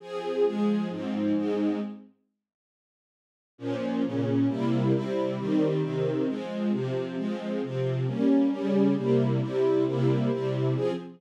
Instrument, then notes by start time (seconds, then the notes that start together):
string ensemble 1
0.00 F3 C4 G#4
0.44 F3 G#3 G#4
0.89 G#2 F3 C4
1.34 G#2 G#3 C4
3.58 A#2 F3 C#4
4.03 A#2 C#3 C#4
4.48 C3 G3 A#3 E4
4.93 C3 G3 C4 E4
5.37 D#3 G3 C4
5.82 C3 D#3 C4
6.27 F3 G#3 C4
6.71 C3 F3 C4
7.17 F3 G#3 C4
7.61 C3 F3 C4
8.06 G3 A#3 C#4
8.51 C#3 G3 C#4
8.96 C3 G3 A#3 E4
9.40 C3 G3 C4 E4
9.85 C3 G3 A#3 E4
10.30 C3 G3 C4 E4
10.74 F3 C4 G#4